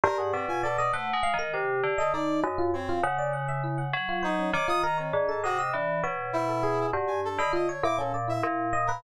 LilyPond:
<<
  \new Staff \with { instrumentName = "Electric Piano 1" } { \time 5/8 \tempo 4 = 100 c''16 gis'16 d''16 f'16 d''16 dis''16 fis''8 f''16 ais'16 | g'8. dis''16 dis'8 dis''16 f'16 cis''16 f'16 | fis''16 d''16 fis''16 e''16 e'16 fis''16 r16 f'16 c''16 cis'16 | cis''16 f'16 ais'16 cis''16 d'16 a'16 dis''16 dis''16 d'8 |
cis''8 c''16 a'16 gis'8 fis'16 d'8 dis''16 | f'16 cis''16 e'16 cis'16 d''16 e'8. dis''16 b'16 | }
  \new Staff \with { instrumentName = "Tubular Bells" } { \time 5/8 g,8 b,4 \tuplet 3/2 { a8 gis8 dis8 } | c8 d8 r8 fis,8 r8 | cis4. fis4 | dis4 gis,8 c8 e8 |
b,4. g,8 r16 d16 | r8 ais,4 ais,4 | }
  \new Staff \with { instrumentName = "Brass Section" } { \time 5/8 ais'16 fis''16 c'16 gis''16 a'16 d''16 c''16 r8. | r8. a'16 d''8 r8 c'8 | r2 dis'8 | d'''16 dis'''16 ais''16 c'16 r16 a''16 fis'16 e'''16 r8 |
r8 e'4 r16 gis''16 a'16 b''16 | dis''16 cis''16 d'''16 a'16 r16 e''16 r8. ais'16 | }
>>